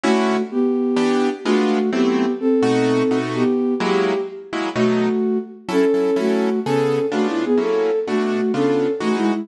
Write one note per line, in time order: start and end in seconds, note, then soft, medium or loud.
0.03 0.37 D3 loud
0.03 0.42 A3 medium
0.03 0.37 C#4 medium
0.03 0.37 E4 loud
0.03 0.37 F#4 medium
0.03 0.42 F#4 medium
0.51 1.28 B3 medium
0.51 1.28 G4 medium
0.96 1.29 E3 medium
0.96 1.29 B3 medium
0.96 1.29 D4 medium
0.96 1.29 G4 medium
1.45 1.78 G#3 loud
1.45 1.90 A3 medium
1.45 1.78 B3 medium
1.45 1.78 D4 medium
1.45 1.78 F4 medium
1.45 1.90 F#4 medium
1.92 2.26 F#3 medium
1.92 2.26 A3 medium
1.92 2.32 B3 medium
1.92 2.26 C4 loud
1.92 2.26 E4 medium
1.92 2.32 G4 medium
2.40 3.18 C4 medium
2.40 3.18 A4 medium
2.63 3.03 B2 medium
2.63 3.03 A3 loud
2.63 3.03 D#4 medium
2.63 3.03 F#4 loud
3.11 3.44 B2 medium
3.11 3.44 A3 medium
3.11 3.44 D#4 medium
3.11 3.44 F#4 medium
3.34 3.74 B3 medium
3.34 3.74 G4 medium
3.80 4.13 F#3 loud
3.80 4.13 G#3 loud
3.80 4.13 A#3 medium
3.80 4.13 E4 medium
3.80 4.20 G4 medium
4.53 4.69 F#3 medium
4.53 4.69 G#3 medium
4.53 4.69 A#3 medium
4.53 4.69 E4 medium
4.76 5.09 B2 medium
4.76 5.09 F#3 medium
4.76 5.09 A3 medium
4.76 5.38 A3 medium
4.76 5.09 D#4 medium
4.76 5.38 F#4 medium
5.69 5.85 F#3 medium
5.69 5.85 C#4 medium
5.69 6.17 C#4 medium
5.69 5.85 E4 medium
5.69 5.85 A4 medium
5.69 6.17 A4 loud
5.94 6.10 F#3 medium
5.94 6.10 C#4 medium
5.94 6.10 E4 medium
5.94 6.10 A4 medium
6.16 6.49 F#3 medium
6.16 6.60 A3 medium
6.16 6.49 C#4 medium
6.16 6.49 E4 medium
6.16 6.60 F#4 medium
6.16 6.49 A4 medium
6.65 6.99 C#3 medium
6.65 6.99 B3 medium
6.65 7.06 C#4 medium
6.65 6.99 G#4 medium
6.65 7.06 A4 medium
6.65 6.99 A4 medium
7.12 7.45 C#3 medium
7.12 7.27 A3 medium
7.12 7.45 B3 medium
7.12 7.45 D4 medium
7.12 7.45 F4 medium
7.12 7.27 F#4 medium
7.28 7.43 E4 medium
7.44 7.59 B3 medium
7.44 7.59 G#4 medium
7.57 7.91 F#3 medium
7.57 7.91 A#3 medium
7.57 7.91 C#4 medium
7.57 7.91 E4 medium
7.57 7.99 A4 medium
8.07 8.41 B2 medium
8.07 8.52 A3 medium
8.07 8.41 A3 medium
8.07 8.41 D4 medium
8.07 8.52 F#4 medium
8.07 8.41 F#4 medium
8.54 8.87 C#3 medium
8.54 8.87 B3 medium
8.54 8.92 C#4 medium
8.54 8.87 D4 medium
8.54 8.87 F4 medium
8.54 8.92 A4 medium
9.00 9.33 E3 medium
9.00 9.33 G#3 medium
9.00 9.16 A3 medium
9.00 9.33 D#4 medium
9.00 9.33 F#4 medium
9.00 9.16 F#4 medium
9.16 9.31 G#3 medium
9.16 9.31 E4 medium
9.33 9.48 G#3 medium
9.33 9.48 E4 medium